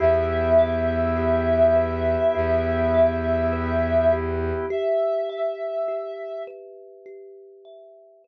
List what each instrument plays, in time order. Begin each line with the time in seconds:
0.00 violin E2, drawbar organ B3 E4 G4, kalimba G4, ocarina E5
0.59 kalimba E5
1.17 kalimba G4
1.76 kalimba B4
2.35 violin E2, kalimba G4
2.94 kalimba E5
3.53 kalimba B4
4.13 kalimba G4
4.70 kalimba G4, ocarina E5
5.29 kalimba E5
5.88 kalimba G4
6.47 kalimba B4
7.06 kalimba G4
7.65 kalimba E5
8.24 kalimba B4